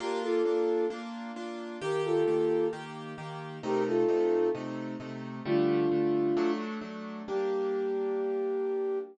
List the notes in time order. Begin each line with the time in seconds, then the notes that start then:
0.00 A#3 D4 F4 G4 A#4
0.23 F4 A4
0.45 A#3 D4 F4
0.90 A#3 D4 F4
1.36 A#3 D4 F4
1.81 D#3 A#3 G4 A#4
2.05 F4 A4
2.27 D#3 A#3 G4
2.73 D#3 A#3 G4
3.18 D#3 A#3 G4
3.63 C3 A3 D#4 G4 A#4
3.87 F4 A4
4.08 C3 A3 D#4
4.55 C3 A3 D#4
5.00 C3 A3 D#4
5.45 D3 G3 A3 D4 F4
5.91 D3 G3 A3
6.37 F#3 A3 D4
6.81 F#3 A3 D4
7.28 G3 A#3 D4 G4